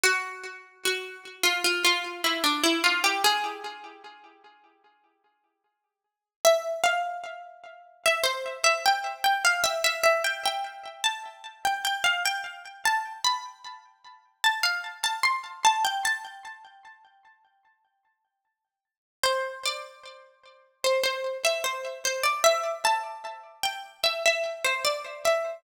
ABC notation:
X:1
M:4/4
L:1/16
Q:1/4=75
K:Am
V:1 name="Pizzicato Strings"
^F4 F3 =F F F2 E D E F G | ^G10 z6 | [K:C] e2 f6 e c2 e g2 g f | e e e g g3 a3 g g f g2 z |
a2 b6 a f2 a c'2 a g | a12 z4 | [K:Am] c2 d6 c c2 e c2 c d | e2 a4 g2 e e2 c d2 e2 |]